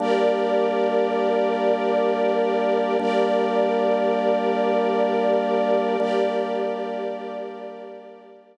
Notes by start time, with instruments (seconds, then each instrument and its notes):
0.00 drawbar organ G3 A#3 D4, string ensemble 1 G4 A#4 D5
2.99 drawbar organ G3 A#3 D4, string ensemble 1 G4 A#4 D5
6.00 drawbar organ G3 A#3 D4, string ensemble 1 G4 A#4 D5